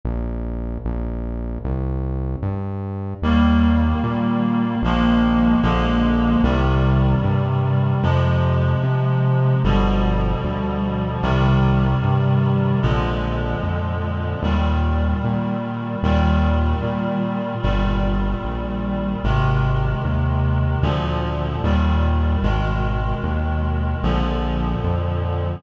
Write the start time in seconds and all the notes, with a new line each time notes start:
0.05 A#1
0.85 A#1
1.64 C2
2.42 G2
3.22 D#2 D#3 G3 A#3
4.04 A#2
4.82 A#1 D#3 F3 G#3 A#3
5.62 A#1 D3 F3 G#3 A#3
6.43 C2 C3 D#3 G3
7.23 G2
8.03 F2 C3 F3 G#3
8.83 C3
9.64 G1 B2 D3 F3 G3
10.44 D2
11.22 C2 C3 D#3 G3
12.03 G2
12.82 A#1 A#2 D3 F3 G#3
13.63 F2
14.43 D#2 A#2 D#3 G3
15.24 A#2
16.03 D#2 A#2 D#3 G3
16.83 A#2
17.62 G1 A#2 D#3 G3
18.44 A#1
19.24 G#1 C3 D#3 G#3
20.05 D#2
20.82 D2 A#2 D3 F3
21.64 D#2 A#2 D#3 G3
22.43 G#1 B2 D#3 G#3
23.23 D#2
24.03 A#1 A#2 D3 F3
24.84 F2